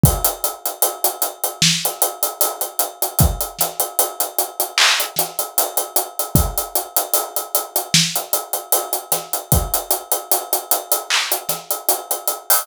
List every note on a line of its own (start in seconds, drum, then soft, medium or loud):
0.03 kick loud
0.03 closed hi-hat loud
0.25 closed hi-hat medium
0.44 closed hi-hat medium
0.66 closed hi-hat medium
0.82 closed hi-hat medium
1.04 closed hi-hat medium
1.22 closed hi-hat medium
1.44 closed hi-hat medium
1.62 snare loud
1.85 closed hi-hat medium
2.02 closed hi-hat medium
2.23 closed hi-hat medium
2.41 closed hi-hat loud
2.61 closed hi-hat medium
2.79 closed hi-hat medium
3.02 closed hi-hat medium
3.19 kick loud
3.19 closed hi-hat loud
3.41 closed hi-hat medium
3.59 snare soft
3.59 closed hi-hat medium
3.80 closed hi-hat medium
3.99 closed hi-hat loud
4.20 closed hi-hat medium
4.38 closed hi-hat medium
4.60 closed hi-hat medium
4.78 clap loud
5.00 closed hi-hat medium
5.16 snare soft
5.16 closed hi-hat medium
5.39 closed hi-hat medium
5.58 closed hi-hat loud
5.77 closed hi-hat medium
5.96 closed hi-hat medium
6.19 closed hi-hat medium
6.35 kick loud
6.35 closed hi-hat loud
6.58 closed hi-hat medium
6.75 closed hi-hat medium
6.97 closed hi-hat medium
7.13 closed hi-hat loud
7.36 closed hi-hat medium
7.55 closed hi-hat medium
7.76 closed hi-hat medium
7.94 snare loud
8.16 closed hi-hat medium
8.33 closed hi-hat medium
8.53 closed hi-hat medium
8.72 closed hi-hat loud
8.93 closed hi-hat medium
9.12 snare soft
9.12 closed hi-hat medium
9.33 closed hi-hat medium
9.52 kick loud
9.52 closed hi-hat loud
9.74 closed hi-hat medium
9.91 closed hi-hat medium
10.12 closed hi-hat medium
10.32 closed hi-hat loud
10.53 closed hi-hat medium
10.71 closed hi-hat medium
10.92 closed hi-hat medium
11.10 clap medium
11.32 closed hi-hat medium
11.49 snare soft
11.49 closed hi-hat medium
11.71 closed hi-hat medium
11.89 closed hi-hat loud
12.11 closed hi-hat medium
12.27 closed hi-hat medium
12.50 open hi-hat medium